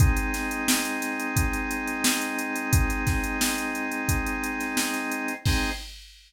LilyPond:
<<
  \new Staff \with { instrumentName = "Drawbar Organ" } { \time 4/4 \key aes \mixolydian \tempo 4 = 88 <aes c' ees'>1~ | <aes c' ees'>1 | <aes c' ees'>4 r2. | }
  \new DrumStaff \with { instrumentName = "Drums" } \drummode { \time 4/4 <hh bd>16 hh16 <hh sn>16 hh16 sn16 hh16 <hh sn>16 hh16 <hh bd>16 hh16 hh16 hh16 sn16 hh16 hh16 hh16 | <hh bd>16 hh16 <hh bd sn>16 hh16 sn16 hh16 hh16 hh16 <hh bd>16 hh16 hh16 <hh sn>16 sn16 <hh sn>16 hh16 hh16 | <cymc bd>4 r4 r4 r4 | }
>>